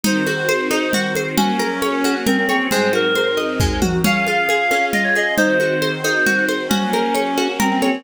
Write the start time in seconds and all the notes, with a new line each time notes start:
0.03 D#3 C4 D#4 F#4 C5, low conga
0.26 F#4, high conga
0.49 C5, high conga
0.70 D#4 C5, high conga
0.93 F#4, low conga
1.15 C5, high conga
1.37 F#3 A#3 C#4 F#4, low conga
1.59 A#4, high conga
1.82 C#5, high conga
2.04 F#4, high conga
2.26 C4 A#4, low conga
2.38 C4
2.49 C4 C#5, high conga
2.69 G#2 F#3 G#3 C4 D#4 C5, low conga
2.93 F#4 A#4, high conga
3.15 C5, high conga
3.37 D#5, high conga
3.60 G#3, kick, floor tom
3.82 F#4, high tom
4.04 C#4 F4 G#4 F5, low conga
4.26 F4, high conga
4.49 G#4, high conga
4.71 C#4, high conga
4.93 F4 D#5, low conga
5.04 C#5
5.15 G#4 D#5, high conga
5.37 D#3 C4 D#4 F#4 C5, low conga
5.60 F#4, high conga
5.82 C5, high conga
6.03 D#4 C5, high conga
6.26 F#4, low conga
6.48 C5, high conga
6.69 F#3 A#3 C#4 F#4, low conga
6.93 A#4, high conga
7.14 C#5, high conga
7.37 F#4, high conga
7.60 C4 A#4, low conga
7.71 C4
7.82 C4 C#5, high conga